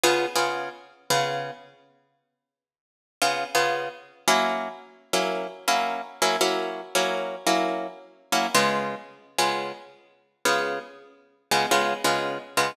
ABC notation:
X:1
M:4/4
L:1/8
Q:"Swing" 1/4=113
K:Db
V:1 name="Acoustic Guitar (steel)"
[D,_CFA] [D,CFA]3 [D,CFA]4- | [D,_CFA]4 [D,CFA] [D,CFA]3 | [G,B,D_F]3 [G,B,DF]2 [G,B,DF]2 [G,B,DF] | [G,B,D_F]2 [G,B,DF]2 [G,B,DF]3 [G,B,DF] |
[D,A,_CF]3 [D,A,CF]4 [D,A,CF]- | [D,A,_CF]3 [D,A,CF] [D,A,CF] [D,A,CF]2 [D,A,CF] |]